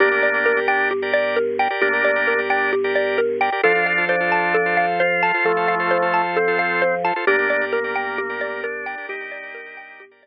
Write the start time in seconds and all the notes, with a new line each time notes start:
0.00 G1 A#3 D4 G4 A#4 D5
0.11 G4 A#4 D5
0.23 D5
0.34 G4 A#4 D5
0.46 A#4
0.57 G4 A#4 D5
0.68 D4 G5
0.91 G4
1.02 G4 A#4 D5
1.14 D5
1.36 A#4
1.59 G4 A#4 D5 G5
1.70 G4 A#4 D5
1.82 G1 A#3 D4 G4
1.93 G4 A#4 D5
2.05 D5
2.16 G4 A#4 D5
2.27 A#4
2.39 G4 A#4 D5
2.50 D4 G5
2.73 G4
2.84 G4 A#4 D5
2.95 D5
3.18 A#4
3.41 G4 A#4 D5 G5
3.52 G4 A#4 D5
3.63 F2 D4 F4 A4 C5
3.75 F4 A4 C5
3.86 F5
3.98 F4 A4 C5
4.09 D4 C5
4.20 F4 A4 C5
4.32 A5
4.54 A4
4.66 F4 A4 C5
4.77 F5
5.00 F4 C5
5.23 F4 A4 C5 A5
5.34 F4 A4 C5
5.45 F2 F3 A3 A4
5.57 F4 A4 C5
5.68 F5
5.80 F4 A4 C5
5.91 C5
6.02 F4 A4 C5
6.14 A5
6.37 C4 A4
6.48 F4 A4 C5
6.59 F5
6.82 C5
7.04 F4 A4 C5 A5
7.16 F4 A4 C5
7.27 G1 A#3 D4 G4 A#4 D5
7.39 G4 A#4 D5
7.50 D5
7.61 G4 A#4 D5
7.73 A#3 A#4
7.84 G4 A#4 D5
7.96 G5
8.18 G4
8.29 G4 A#4 D5
8.41 D5
8.63 D4 A#4
8.86 G4 A#4 D5 G5
8.98 G4 A#4 D5
9.09 G1 D#4 G4
9.20 G4 A#4 D5
9.32 D5
9.43 G4 A#4 D5
9.55 A#4
9.66 G4 A#4 D5
9.77 G5
10.00 G4
10.11 G4 A#4 D5
10.23 D5